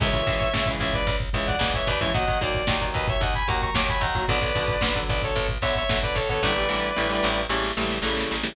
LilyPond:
<<
  \new Staff \with { instrumentName = "Distortion Guitar" } { \time 4/4 \key cis \phrygian \tempo 4 = 112 <cis'' e''>4. <cis'' e''>16 <b' d''>8 r16 <cis'' e''>16 <d'' fis''>8 <cis'' e''>16 <b' d''>16 <cis'' e''>16 | <dis'' fis''>8 d''4 <b' dis''>16 <cis'' e''>16 <dis'' fis''>16 <gis'' b''>16 <fis'' ais''>16 <ais'' cis'''>16 d'''16 <gis'' b''>16 <fis'' ais''>8 | <b' d''>4. <b' d''>16 <a' cis''>8 r16 <cis'' e''>16 <cis'' e''>8 <b' d''>16 <a' cis''>16 <a' cis''>16 | <b' d''>2 r2 | }
  \new Staff \with { instrumentName = "Overdriven Guitar" } { \time 4/4 \key cis \phrygian <cis e gis>16 <cis e gis>16 <cis e gis>8 <cis e gis>16 <cis e gis>4~ <cis e gis>16 <cis e gis>8 <cis e gis>8. <cis e gis>16 | <dis fis ais>16 <dis fis ais>16 <dis fis ais>8 <dis fis ais>16 <dis fis ais>4~ <dis fis ais>16 <dis fis ais>8 <dis fis ais>8. <dis fis ais>16 | <d fis b>16 <d fis b>16 <d fis b>8 <d fis b>16 <d fis b>4~ <d fis b>16 <d fis b>8 <d fis b>8. <d fis b>16 | <d e g a>16 <d e g a>16 <d e g a>8 <d e g a>16 <d e g a>8. <cis e g a>8 <cis e g a>8 <cis e g a>8. <cis e g a>16 | }
  \new Staff \with { instrumentName = "Electric Bass (finger)" } { \clef bass \time 4/4 \key cis \phrygian cis,8 cis,8 cis,8 cis,8 cis,8 cis,8 cis,8 dis,8~ | dis,8 dis,8 dis,8 dis,8 dis,8 dis,8 dis,8 dis,8 | b,,8 b,,8 b,,8 b,,8 b,,8 b,,8 b,,8 b,,8 | a,,8 a,,8 a,,8 a,,8 a,,8 a,,8 a,,8 a,,8 | }
  \new DrumStaff \with { instrumentName = "Drums" } \drummode { \time 4/4 <cymc bd>16 bd16 <hh bd>16 bd16 <bd sn>16 bd16 <hh bd>16 bd16 <hh bd>16 bd16 <hh bd>16 bd16 <bd sn>16 bd16 <hh bd>16 bd16 | <hh bd>16 bd16 <hh bd>16 bd16 <bd sn>16 bd16 <hh bd>16 bd16 <hh bd>16 bd16 <hh bd>16 bd16 <bd sn>16 bd16 <hh bd>16 bd16 | <hh bd>16 bd16 <hh bd>16 bd16 <bd sn>16 bd16 <hh bd>16 bd16 <hh bd>16 bd16 <hh bd>16 bd16 <bd sn>16 bd16 <hh bd>16 bd16 | <bd sn>8 sn8 sn8 sn8 sn16 sn16 sn16 sn16 sn16 sn16 sn16 sn16 | }
>>